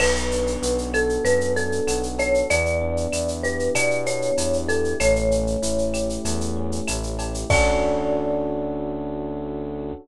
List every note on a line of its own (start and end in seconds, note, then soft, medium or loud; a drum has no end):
0.00 0.57 B1 loud
0.00 1.24 B3 medium
0.00 0.86 B4 medium
0.00 crash loud
0.00 cowbell loud
0.00 claves loud
0.16 shaker medium
0.31 1.56 D4 medium
0.31 shaker medium
0.47 shaker medium
0.62 1.19 B1 loud
0.62 1.87 F#4 medium
0.62 shaker loud
0.78 shaker medium
0.94 2.18 A4 medium
0.94 1.24 A4 medium
0.94 claves medium
0.94 shaker medium
1.09 shaker medium
1.24 1.81 F#2 medium
1.24 2.44 B3 medium
1.24 1.52 B4 medium
1.24 cowbell medium
1.24 shaker loud
1.41 shaker medium
1.56 2.45 D4 medium
1.56 2.07 A4 medium
1.56 shaker medium
1.72 shaker medium
1.87 2.43 B1 medium
1.87 2.47 F#4 medium
1.87 cowbell medium
1.87 claves medium
1.87 shaker loud
2.03 shaker medium
2.19 2.48 A4 medium
2.19 2.45 C#5 medium
2.19 cowbell medium
2.19 shaker medium
2.34 shaker medium
2.50 3.07 E2 loud
2.50 3.75 B3 medium
2.50 3.30 D5 loud
2.50 cowbell medium
2.50 shaker loud
2.66 shaker medium
2.81 4.06 D4 medium
2.97 shaker medium
3.12 3.69 E2 medium
3.12 4.37 E4 medium
3.12 claves medium
3.12 shaker loud
3.28 shaker medium
3.43 4.68 G4 medium
3.43 3.71 B4 medium
3.43 shaker medium
3.59 shaker medium
3.75 4.31 B2 loud
3.75 4.94 B3 medium
3.75 4.03 D5 medium
3.75 cowbell medium
3.75 claves medium
3.75 shaker loud
3.91 shaker medium
4.06 4.95 D4 medium
4.06 4.57 C#5 medium
4.06 shaker medium
4.22 shaker medium
4.38 4.94 E2 medium
4.38 4.97 E4 medium
4.38 cowbell medium
4.38 shaker loud
4.53 shaker medium
4.68 4.98 G4 medium
4.68 4.97 A4 medium
4.68 cowbell medium
4.68 shaker medium
4.84 shaker medium
5.00 5.56 A1 loud
5.00 6.24 A3 medium
5.00 6.19 C#5 medium
5.00 cowbell loud
5.00 claves medium
5.00 shaker loud
5.16 shaker medium
5.31 6.56 C#4 medium
5.31 shaker medium
5.47 shaker medium
5.62 6.18 A1 medium
5.62 6.87 E4 medium
5.62 shaker loud
5.78 shaker medium
5.94 7.18 G4 medium
5.94 claves medium
5.94 shaker medium
6.09 shaker medium
6.24 6.81 E2 loud
6.24 7.44 A3 medium
6.24 cowbell medium
6.24 shaker loud
6.41 shaker medium
6.56 7.45 C#4 medium
6.72 shaker medium
6.88 7.45 A1 loud
6.88 7.47 E4 medium
6.88 cowbell medium
6.88 claves loud
6.88 shaker loud
7.03 shaker medium
7.19 7.48 G4 medium
7.19 cowbell medium
7.19 shaker medium
7.34 shaker medium
7.49 9.92 D2 loud
7.49 9.93 C#4 loud
7.49 9.93 D4 loud
7.49 9.93 F#4 loud
7.49 9.93 A4 loud
7.49 9.93 D5 loud
7.49 kick loud
7.49 crash loud